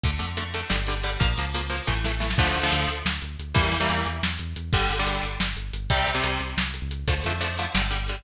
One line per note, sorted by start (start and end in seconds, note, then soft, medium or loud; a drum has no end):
0.03 0.18 D2 medium
0.03 0.11 D3 medium
0.03 0.11 A3 medium
0.03 kick medium
0.03 closed hi-hat medium
0.19 0.63 F2 medium
0.19 0.26 D3 medium
0.19 0.26 A3 medium
0.19 closed hi-hat medium
0.37 0.44 D3 medium
0.37 0.44 A3 medium
0.37 closed hi-hat medium
0.54 0.61 D3 medium
0.54 0.61 A3 medium
0.54 closed hi-hat medium
0.69 1.17 G1 medium
0.69 0.76 D3 medium
0.69 0.76 G3 medium
0.69 snare medium
0.87 0.95 D3 medium
0.87 0.95 G3 medium
0.87 closed hi-hat medium
1.03 1.10 D3 medium
1.03 1.10 G3 medium
1.03 closed hi-hat medium
1.20 1.35 A#1 loud
1.20 1.27 F3 medium
1.20 1.27 A#3 medium
1.20 kick loud
1.20 closed hi-hat medium
1.38 1.81 C#2 medium
1.38 1.45 F3 medium
1.38 1.45 A#3 medium
1.38 closed hi-hat medium
1.54 1.61 F3 medium
1.54 1.61 A#3 medium
1.54 closed hi-hat medium
1.69 1.76 F3 medium
1.69 1.76 A#3 medium
1.69 closed hi-hat medium
1.87 2.34 A1 medium
1.87 1.94 E3 medium
1.87 1.94 A3 medium
1.87 kick medium
1.87 snare medium
2.04 2.12 E3 medium
2.04 2.12 A3 medium
2.04 snare medium
2.20 2.27 E3 medium
2.20 2.27 A3 medium
2.20 snare medium
2.30 snare medium
2.38 2.52 D2 medium
2.38 2.59 D3 loud
2.38 2.59 F3 loud
2.38 2.59 A3 loud
2.38 kick loud
2.38 crash loud
2.55 2.69 D2 medium
2.55 closed hi-hat medium
2.63 2.90 D3 loud
2.63 2.90 F3 medium
2.63 2.90 A3 medium
2.72 2.86 D2 medium
2.72 closed hi-hat medium
2.88 3.02 D2 medium
2.88 closed hi-hat medium
3.05 3.19 D2 medium
3.05 snare loud
3.22 3.37 D2 medium
3.22 closed hi-hat medium
3.39 3.53 D2 medium
3.39 closed hi-hat medium
3.54 3.69 E2 medium
3.54 3.74 E3 loud
3.54 3.74 G3 loud
3.54 3.74 A#3 loud
3.54 kick loud
3.54 closed hi-hat medium
3.72 3.86 E2 medium
3.72 closed hi-hat medium
3.80 4.07 E3 medium
3.80 4.07 G3 medium
3.80 4.07 A#3 medium
3.89 4.03 E2 medium
3.89 closed hi-hat medium
4.06 4.20 E2 medium
4.06 closed hi-hat medium
4.23 4.37 E2 medium
4.23 snare loud
4.39 4.54 E2 medium
4.39 closed hi-hat medium
4.56 4.70 E2 medium
4.56 closed hi-hat medium
4.73 4.87 G1 medium
4.73 4.93 D3 loud
4.73 4.93 G3 loud
4.73 kick medium
4.73 closed hi-hat medium
4.89 5.04 G1 medium
4.89 closed hi-hat medium
4.99 5.26 D3 loud
4.99 5.26 G3 medium
5.06 5.20 G1 medium
5.06 closed hi-hat loud
5.23 5.37 G1 medium
5.23 closed hi-hat medium
5.40 5.54 G1 medium
5.40 snare loud
5.56 5.71 G1 medium
5.56 closed hi-hat medium
5.73 5.87 G1 medium
5.73 closed hi-hat medium
5.90 6.04 C2 medium
5.90 6.10 C3 loud
5.90 6.10 G3 loud
5.90 kick medium
5.90 closed hi-hat medium
6.07 6.21 C2 medium
6.07 closed hi-hat medium
6.14 6.41 C3 loud
6.14 6.41 G3 loud
6.24 6.38 C2 medium
6.24 closed hi-hat loud
6.40 6.54 C2 medium
6.40 closed hi-hat medium
6.57 6.80 C2 medium
6.57 snare loud
6.74 closed hi-hat medium
6.82 7.05 C#2 medium
6.91 closed hi-hat medium
7.07 7.22 D2 medium
7.07 7.14 D3 medium
7.07 7.14 F3 medium
7.07 7.14 A3 medium
7.07 kick medium
7.07 closed hi-hat medium
7.24 7.67 F2 medium
7.24 7.33 D3 medium
7.24 7.33 F3 medium
7.24 7.33 A3 medium
7.24 closed hi-hat medium
7.40 7.47 D3 medium
7.40 7.47 F3 medium
7.40 7.47 A3 medium
7.40 closed hi-hat medium
7.58 7.65 D3 medium
7.58 7.65 F3 medium
7.58 7.65 A3 medium
7.58 closed hi-hat medium
7.74 8.21 G1 medium
7.74 7.82 D3 medium
7.74 7.82 G3 medium
7.74 snare loud
7.90 7.97 D3 medium
7.90 7.97 G3 medium
7.90 closed hi-hat medium
8.08 8.16 D3 medium
8.08 8.16 G3 medium
8.08 closed hi-hat medium